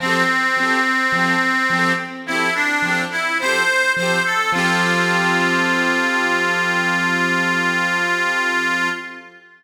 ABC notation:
X:1
M:4/4
L:1/16
Q:1/4=53
K:F
V:1 name="Accordion"
C8 E D2 E c2 c A | F16 |]
V:2 name="Acoustic Grand Piano"
[F,CGA]2 [F,CGA]2 [F,CGA]2 [F,CGA]2 [F,CGA]2 [F,CGA]2 [F,CGA]2 [F,CGA]2 | [F,CGA]16 |]